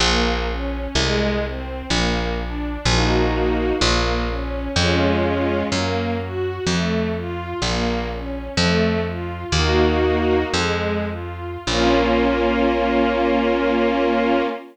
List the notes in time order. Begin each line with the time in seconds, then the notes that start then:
0.00 A#1 A#3
0.47 C#4
0.95 C2 G#3
1.42 C4
1.90 A#1 A#3
2.38 D4
2.85 A#1 A#3 D#4 F#4
3.81 A#1 A#3
4.29 C#4
4.76 F2 G#3 C#4 F4
5.72 F#2 A#3
6.19 F#4
6.66 F2 A3
7.14 F4
7.62 A#1 A#3
8.10 C#4
8.57 F2 A3
9.05 F4
9.52 D#2 A#3 D#4 F#4
10.53 F2 G#3
11.08 F4
11.67 A#1 A#3 C#4 F4